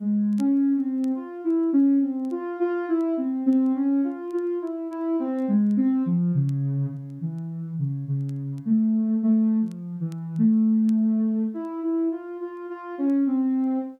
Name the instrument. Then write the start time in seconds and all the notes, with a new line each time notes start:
ocarina
0.00 G#3
0.38 C#4
0.77 C4
1.15 F4
1.44 E4
1.73 C#4
2.02 C4
2.31 F4
2.60 F4
2.88 E4
3.17 C4
3.46 C4
3.75 C#4
4.04 F4
4.33 F4
4.62 E4
4.90 E4
5.19 C4
5.48 G#3
5.77 C4
6.06 F3
6.35 C#3
6.92 C#3
7.21 E3
7.79 C#3
8.08 C#3
8.65 A3
9.23 A3
9.62 F3
10.00 E3
10.38 A3
11.54 E4
11.83 E4
12.12 F4
12.40 F4
12.69 F4
12.98 C#4
13.27 C4